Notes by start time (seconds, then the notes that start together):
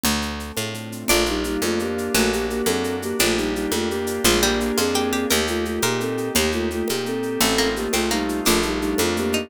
0.04 D2 A3, low conga, shaker
0.21 C4, shaker
0.39 D4, shaker
0.57 A2 F4, high conga, shaker
0.74 A3, shaker
0.92 C4, shaker
1.08 A#1 A3 A#3 D4 F4, low conga, shaker
1.26 G3 D#4 F4, shaker
1.44 G3 A#3 D#4, shaker
1.62 F2 A3 D4 F4, high conga, shaker
1.79 A#3 G4, shaker
1.97 F4, shaker
2.14 A#1 F#3 A3 A#3 D4 F#4, low conga, shaker
2.32 A#3 F#4 G4, shaker
2.49 A#3 G4, shaker
2.66 F#2 C4 D4 A4, high conga, shaker
2.84 A#3, shaker
3.02 A#3 F#4 G4, shaker
3.19 A#1 A3 A#3 D4 F4 G4, low conga, shaker
3.37 G3 D4 D#4, shaker
3.55 G3 D#4 F4, shaker
3.72 F2 A3 F4 G4, high conga, shaker
3.89 A#3 G4, shaker
4.07 D4, shaker
4.24 A#1 F3 G#3 A#3 D4 F4 G#4, low conga, shaker
4.42 G3 A#3 D4 G4, shaker
4.60 A#3 F4 G4, shaker
4.77 F2 C4 F4 G#4, high conga, shaker
4.94 A#3 G4, shaker
5.12 C4 D4 G4 G#4, shaker
5.30 D#2 A#3 D#4 G4 A#4, low conga, shaker
5.47 A3 F4 G4, shaker
5.65 A3 A#3 F4, shaker
5.82 A#2 A#3 D#4 G4 A#4, high conga, shaker
6.00 A#3 C4 A4, shaker
6.18 G4, shaker
6.35 D#2 A#3 D#4 G4, low conga, shaker
6.52 A3 F4 G4, shaker
6.71 A3 A#3 F4, shaker
6.88 A#2 A#3 D#4 G4, high conga, shaker
7.05 A#3 C4 A4, shaker
7.23 G4, shaker
7.40 A1 A3 C4 D#4 F4 A4, low conga, shaker
7.58 A#3 F4, shaker
7.76 A3 A#3 G4, shaker
7.93 C2 A3 C4 D#4 F4, high conga, shaker
8.11 G3 A3 A#3 D#4, shaker
8.28 F4, shaker
8.45 A#1 A3 A#3 D4 F4, low conga, shaker
8.62 G3 A#3 D#4, shaker
8.81 G3 D4 D#4, shaker
8.98 F2 A3 F4, high conga, shaker
9.16 A3 A#3 G4, shaker
9.32 A#3 D#4, shaker